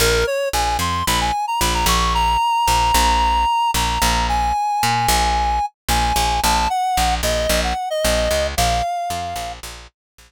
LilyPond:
<<
  \new Staff \with { instrumentName = "Clarinet" } { \time 4/4 \key bes \minor \tempo 4 = 112 bes'8 des''8 aes''8 c'''8 b''16 aes''8 bes''16 b''16 bes''16 des'''8 | bes''2. bes''4 | aes''2. aes''4 | a''8 ges''4 ees''8. ges''8 ees''4~ ees''16 |
f''2 r2 | }
  \new Staff \with { instrumentName = "Electric Bass (finger)" } { \clef bass \time 4/4 \key bes \minor bes,,4 bes,,8 f,8 bes,,4 bes,,8 bes,,8~ | bes,,4 bes,,8 bes,,4. bes,,8 bes,,8~ | bes,,4 bes,8 bes,,4. bes,,8 bes,,8 | bes,,4 bes,,8 bes,,8 bes,,4 bes,,8 des,8 |
bes,,4 f,8 bes,,8 bes,,4 bes,,8 r8 | }
>>